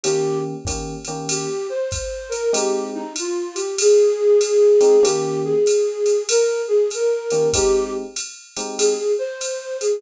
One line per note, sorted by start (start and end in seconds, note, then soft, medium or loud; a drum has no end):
0.03 0.53 D#3 medium
0.03 0.53 A#3 medium
0.03 0.53 C#4 medium
0.03 0.38 G4 medium
0.03 0.53 G4 medium
0.03 ride medium
0.65 0.94 D#3 medium
0.65 0.94 A#3 medium
0.65 0.94 C#4 medium
0.65 0.94 G4 medium
0.65 kick soft
0.65 hi-hat pedal medium
0.65 ride medium
1.05 1.46 D#3 medium
1.05 1.46 A#3 medium
1.05 1.46 C#4 medium
1.05 1.46 G4 medium
1.05 ride medium
1.29 1.67 G4 medium
1.29 ride medium
1.69 2.30 C5 medium
1.91 kick soft
1.91 hi-hat pedal medium
1.91 ride medium
2.29 2.50 A#4 medium
2.29 ride medium
2.53 3.02 G#3 medium
2.53 3.02 C4 medium
2.53 3.02 D#4 medium
2.53 3.02 G4 medium
2.53 2.88 G4 medium
2.53 ride medium
2.94 3.13 D#4 medium
3.16 3.58 F4 medium
3.16 hi-hat pedal medium
3.16 ride medium
3.55 3.75 G4 medium
3.55 ride medium
3.78 5.03 G#4 medium
3.78 ride medium
4.41 hi-hat pedal medium
4.41 ride medium
4.81 4.96 G#3 medium
4.81 4.96 C4 medium
4.81 4.96 D#4 medium
4.81 4.96 G4 medium
4.81 ride medium
5.03 5.52 D#3 medium
5.03 5.52 A#3 medium
5.03 5.52 C#4 medium
5.03 5.52 G4 medium
5.03 5.39 G4 medium
5.03 ride medium
5.44 6.23 G#4 medium
5.66 hi-hat pedal medium
5.66 ride medium
6.06 ride medium
6.29 6.61 A#4 medium
6.29 ride medium
6.68 6.90 G#4 medium
6.90 7.48 A#4 medium
6.90 hi-hat pedal medium
6.90 ride medium
7.30 7.47 D#3 medium
7.30 7.47 A#3 medium
7.30 7.47 C#4 medium
7.30 7.47 G4 medium
7.30 ride medium
7.53 8.03 G#3 medium
7.53 8.03 C4 medium
7.53 8.03 D#4 medium
7.53 8.03 G4 medium
7.53 7.91 G4 medium
7.53 kick soft
7.53 ride medium
8.16 hi-hat pedal medium
8.16 ride medium
8.57 8.95 G#3 medium
8.57 8.95 C4 medium
8.57 8.95 D#4 medium
8.57 8.95 G4 medium
8.57 ride medium
8.78 9.12 G#4 medium
8.78 ride medium
9.18 9.76 C5 medium
9.41 hi-hat pedal medium
9.41 ride medium
9.81 9.99 G#4 medium
9.81 ride medium